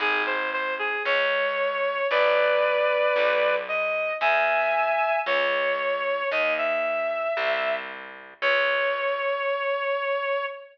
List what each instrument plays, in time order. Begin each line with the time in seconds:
0.00 electric bass (finger) G#1, clarinet G#4
0.26 clarinet C5
0.53 clarinet C5
0.79 clarinet G#4
1.05 electric bass (finger) C#2, clarinet C#5
2.11 electric bass (finger) A1, clarinet B4 D5
3.16 electric bass (finger) B1
3.68 clarinet D#5
4.21 electric bass (finger) E2, clarinet E5 G#5
5.26 electric bass (finger) C#2, clarinet C#5
6.31 electric bass (finger) D#2, clarinet D#5
6.58 clarinet E5
7.37 electric bass (finger) C2
8.42 electric bass (finger) C#2, clarinet C#5